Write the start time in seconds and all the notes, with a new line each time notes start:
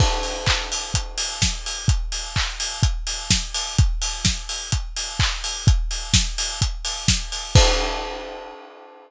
0.00 kick, crash
0.23 open hi-hat
0.46 kick, clap
0.72 open hi-hat
0.94 kick, closed hi-hat
1.18 open hi-hat
1.42 kick, snare
1.66 open hi-hat
1.88 kick, closed hi-hat
2.12 open hi-hat
2.36 kick, clap
2.60 open hi-hat
2.83 kick, closed hi-hat
3.07 open hi-hat
3.31 kick, snare
3.54 open hi-hat
3.78 kick, closed hi-hat
4.02 open hi-hat
4.25 kick, snare
4.49 open hi-hat
4.72 kick, closed hi-hat
4.96 open hi-hat
5.19 kick, clap
5.44 open hi-hat
5.67 kick, closed hi-hat
5.91 open hi-hat
6.14 kick, snare
6.38 open hi-hat
6.62 kick, closed hi-hat
6.85 open hi-hat
7.08 kick, snare
7.32 open hi-hat
7.55 kick, crash